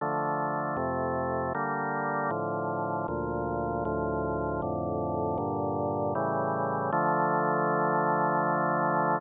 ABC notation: X:1
M:3/4
L:1/8
Q:1/4=78
K:Dm
V:1 name="Drawbar Organ"
[D,F,A,]2 [F,,C,A,]2 [D,G,B,]2 | [A,,D,F,]2 [D,,B,,F,]2 [D,,A,,F,]2 | [F,,A,,D,]2 [G,,B,,D,]2 [A,,^C,E,G,]2 | [D,F,A,]6 |]